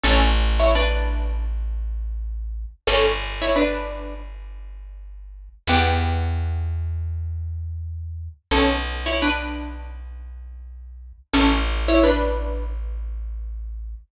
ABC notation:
X:1
M:4/4
L:1/16
Q:"Swing 16ths" 1/4=85
K:Bm
V:1 name="Pizzicato Strings"
[CA] z2 [Ec] [DB]4 z8 | [CA] z2 [Ec] [DB]4 z8 | [B,G]6 z10 | [CA] z2 [Ec] [DB]4 z8 |
[CA] z2 [Ec] [DB]4 z8 |]
V:2 name="Electric Bass (finger)" clef=bass
A,,,16 | G,,,16 | E,,16 | B,,,16 |
A,,,16 |]